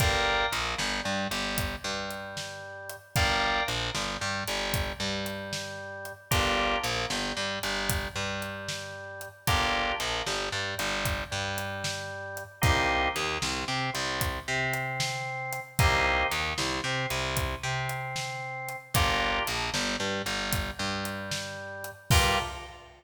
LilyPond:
<<
  \new Staff \with { instrumentName = "Drawbar Organ" } { \time 12/8 \key g \minor \tempo 4. = 76 <bes' d'' f'' g''>4 bes8 g8 g8 g4 g2~ g8 | <bes' d'' f'' g''>4 bes8 g8 g8 g4 g2~ g8 | <bes d' f' g'>4 bes8 g8 g8 g4 g2~ g8 | <bes d' f' g'>4 bes8 g8 g8 g4 g2~ g8 |
<bes c' ees' g'>4 ees8 c8 c'8 c4 c'2~ c'8 | <bes c' ees' g'>4 ees8 c8 c'8 c4 c'2~ c'8 | <bes d' f' g'>4 bes8 g8 g8 g4 g2~ g8 | <bes d' f' g'>4. r1 r8 | }
  \new Staff \with { instrumentName = "Electric Bass (finger)" } { \clef bass \time 12/8 \key g \minor g,,4 bes,,8 g,,8 g,8 g,,4 g,2~ g,8 | g,,4 bes,,8 g,,8 g,8 g,,4 g,2~ g,8 | g,,4 bes,,8 g,,8 g,8 g,,4 g,2~ g,8 | g,,4 bes,,8 g,,8 g,8 g,,4 g,2~ g,8 |
c,4 ees,8 c,8 c8 c,4 c2~ c8 | c,4 ees,8 c,8 c8 c,4 c2~ c8 | g,,4 bes,,8 g,,8 g,8 g,,4 g,2~ g,8 | g,4. r1 r8 | }
  \new DrumStaff \with { instrumentName = "Drums" } \drummode { \time 12/8 <hh bd>4 hh8 sn4 hh8 <hh bd>4 hh8 sn4 hh8 | <hh bd>4 hh8 sn4 hh8 <hh bd>4 hh8 sn4 hh8 | <hh bd>4 hh8 sn4 hh8 <hh bd>4 hh8 sn4 hh8 | <hh bd>4 hh8 sn4 hh8 <hh bd>4 hh8 sn4 hh8 |
<hh bd>4 hh8 sn4 hh8 <hh bd>4 hh8 sn4 hh8 | <hh bd>4 hh8 sn4 hh8 <hh bd>4 hh8 sn4 hh8 | <hh bd>4 hh8 sn4 hh8 <hh bd>4 hh8 sn4 hh8 | <cymc bd>4. r4. r4. r4. | }
>>